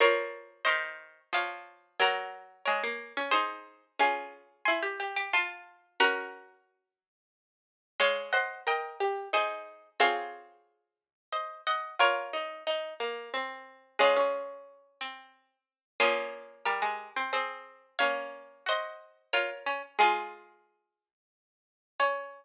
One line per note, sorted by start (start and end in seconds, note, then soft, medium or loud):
0.00 0.62 F3 loud
0.00 1.76 A#4 loud
0.00 0.60 A#4 medium
0.00 1.76 C#5 loud
0.00 0.60 C#5 loud
0.65 1.20 D#3 loud
0.65 1.29 C5 medium
0.65 1.29 D#5 medium
1.33 1.98 F3 medium
1.33 1.93 C#5 medium
1.33 1.93 F5 medium
2.00 2.65 F#3 loud
2.00 3.86 F#4 loud
2.00 2.62 F#4 medium
2.00 3.86 A#4 loud
2.00 2.62 A#4 loud
2.65 2.83 G#3 loud
2.65 3.30 A#4 medium
2.65 3.30 C#5 medium
2.83 3.13 A#3 medium
3.17 3.33 C#4 loud
3.31 3.92 D#4 medium
3.31 3.85 G#4 medium
3.31 3.85 C5 loud
3.99 4.62 C#4 loud
3.99 4.83 F4 loud
3.99 4.83 G#4 loud
3.99 4.57 F5 medium
3.99 4.57 G#5 loud
4.65 4.84 E4 loud
4.65 5.24 G#5 medium
4.65 5.24 C6 medium
4.83 5.11 G4 medium
5.00 5.27 G4 loud
5.16 5.32 G4 loud
5.33 5.97 F4 loud
5.33 5.89 F4 medium
5.33 5.89 A5 medium
5.33 5.89 C6 medium
6.00 7.24 C#4 loud
6.00 7.09 F#4 loud
6.00 7.09 A#4 loud
6.00 6.90 F#5 medium
6.00 6.90 A#5 medium
8.00 9.67 G#3 loud
8.00 8.28 C#5 loud
8.00 8.29 F5 medium
8.00 8.29 G#5 loud
8.33 8.60 C5 medium
8.33 8.63 D#5 medium
8.33 8.63 F#5 medium
8.67 8.94 A#4 loud
8.67 9.30 D#5 medium
8.67 9.30 G5 medium
9.00 9.28 G4 medium
9.33 9.89 D#4 loud
9.33 9.90 G#4 medium
9.33 9.90 C5 medium
10.00 11.90 C4 loud
10.00 11.54 F4 loud
10.00 11.54 G#4 loud
10.00 11.09 C#5 medium
10.00 11.09 F5 loud
11.33 11.62 C5 medium
11.33 11.62 D#5 medium
11.67 11.95 D#5 medium
11.67 11.95 F#5 medium
11.99 13.93 F4 loud
11.99 12.29 F4 loud
11.99 13.87 A#4 medium
11.99 13.87 C#5 loud
12.33 12.63 D#4 medium
12.67 12.94 D#4 loud
13.00 13.30 A#3 loud
13.34 13.97 C4 loud
13.99 14.84 G#3 loud
13.99 14.16 C#4 loud
13.99 15.55 F4 medium
13.99 15.55 G#4 loud
14.17 15.59 C#4 medium
15.01 15.57 C4 medium
16.00 16.63 F3 loud
16.00 17.18 A#3 loud
16.00 17.18 C#4 loud
16.00 16.55 F4 medium
16.00 16.55 G#4 loud
16.65 16.82 G3 medium
16.65 17.29 G4 medium
16.65 17.29 A#4 medium
16.82 17.10 G#3 medium
17.16 17.32 C4 medium
17.33 17.97 C4 loud
17.33 17.98 C4 medium
17.33 17.87 G#4 medium
17.33 17.87 C5 medium
17.99 19.67 A#3 loud
17.99 19.67 C#4 loud
17.99 18.62 C#5 medium
17.99 18.62 F5 loud
18.66 19.27 F#4 medium
18.66 19.34 C5 medium
18.66 19.34 D#5 medium
19.33 19.50 F4 loud
19.33 19.87 A#4 medium
19.33 19.87 C#5 medium
19.66 19.82 C#4 loud
19.99 21.11 G#3 loud
19.99 21.67 F4 loud
19.99 21.89 F4 medium
19.99 21.67 G#4 loud
19.99 21.89 G#4 loud
22.00 22.45 C#4 loud
22.00 22.45 C#5 loud